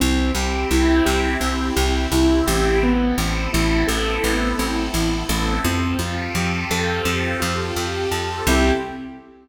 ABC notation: X:1
M:4/4
L:1/8
Q:1/4=85
K:C
V:1 name="Acoustic Grand Piano"
C G E G C G E G | B, C E A B, C E A | C F G A C F G A | [CEG]2 z6 |]
V:2 name="Electric Bass (finger)" clef=bass
C,, C,, C,, C,, C,, C,, C,, A,,,- | A,,, A,,, A,,, A,,, A,,, A,,, A,,, A,,, | F,, F,, F,, F,, F,, F,, F,, F,, | C,,2 z6 |]
V:3 name="Pad 5 (bowed)"
[CEG]8 | [B,CEA]8 | [CFGA]8 | [CEG]2 z6 |]